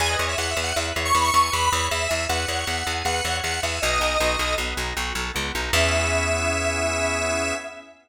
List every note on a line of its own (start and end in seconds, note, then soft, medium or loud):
0.00 0.16 E2 medium
0.00 0.18 B4 loud
0.00 0.09 G#5 medium
0.10 0.26 D#5 medium
0.19 0.35 E2 medium
0.19 0.36 C#5 medium
0.29 0.38 E5 medium
0.38 0.54 E2 medium
0.38 0.55 E5 medium
0.38 0.50 F#5 medium
0.51 0.63 E5 medium
0.57 0.73 E2 medium
0.57 0.74 G#5 medium
0.64 0.76 F#5 medium
0.76 0.93 E2 medium
0.76 0.94 B4 medium
0.76 0.86 E5 medium
0.96 1.12 E2 medium
0.96 1.13 C#5 medium
1.05 1.14 C#6 medium
1.14 1.31 E2 medium
1.14 1.31 E5 medium
1.14 1.24 B5 medium
1.24 1.41 C#6 medium
1.34 1.50 E2 medium
1.34 1.51 G#5 medium
1.43 1.52 C#6 medium
1.52 1.70 E2 medium
1.52 1.69 B4 medium
1.52 1.86 B5 medium
1.72 1.89 E2 medium
1.72 1.90 C#5 medium
1.91 2.07 E2 medium
1.91 2.08 E5 medium
1.91 2.24 E5 medium
2.09 2.27 E2 medium
2.09 2.26 G#5 medium
2.29 2.46 E2 medium
2.29 2.46 B4 medium
2.29 2.92 F#5 medium
2.48 2.65 E2 medium
2.48 2.67 C#5 medium
2.67 2.83 E2 medium
2.67 2.85 E5 medium
2.87 3.03 E2 medium
2.87 3.04 G#5 medium
3.05 3.21 E2 medium
3.05 3.25 B4 medium
3.05 3.37 F#5 medium
3.24 3.41 E2 medium
3.24 3.41 C#5 medium
3.43 3.60 E2 medium
3.43 3.60 E5 medium
3.43 3.60 F#5 medium
3.63 3.79 E2 medium
3.63 3.81 E5 medium
3.63 3.81 G#5 medium
3.82 3.99 B1 medium
3.82 4.00 B3 loud
3.82 4.54 D#5 medium
3.99 4.17 B1 medium
3.99 4.17 D#4 loud
4.20 4.37 B1 medium
4.20 4.39 F#4 medium
4.39 4.55 B1 medium
4.39 4.57 A4 medium
4.58 4.74 B1 medium
4.58 4.77 B3 loud
4.77 4.93 B1 medium
4.77 4.95 D#4 medium
4.97 5.13 B1 medium
4.97 5.15 F#4 medium
5.15 5.31 B1 medium
5.15 5.32 A4 medium
5.34 5.52 C#2 medium
5.34 5.51 B3 medium
5.55 5.71 B1 medium
5.55 5.73 D#4 medium
5.73 7.53 E2 loud
5.73 7.54 B3 loud
5.73 7.54 C#4 loud
5.73 7.54 E4 loud
5.73 7.54 G#4 medium
5.73 7.53 E5 loud